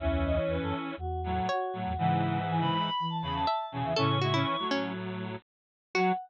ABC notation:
X:1
M:4/4
L:1/16
Q:1/4=121
K:F#dor
V:1 name="Choir Aahs"
e e d c B A z2 F2 F2 F4 | f4 g b2 b2 a b a3 g e | c'6 z10 | f4 z12 |]
V:2 name="Pizzicato Strings"
z12 c4 | z12 e4 | A2 F E3 C2 z8 | F4 z12 |]
V:3 name="Lead 1 (square)"
[E,C]8 z2 [A,,F,]2 z2 [A,,F,]2 | [G,,E,]8 z2 [E,,C,]2 z2 [E,,C,]2 | [E,C]2 [G,E] [E,C]2 [A,,F,]7 z4 | F,4 z12 |]
V:4 name="Flute" clef=bass
[C,,E,,]4 E,, F,, z2 E,,4 z2 A,, E,, | [C,E,]4 E, C, z2 E,4 z2 B,, E, | [A,,C,]4 z12 | F,4 z12 |]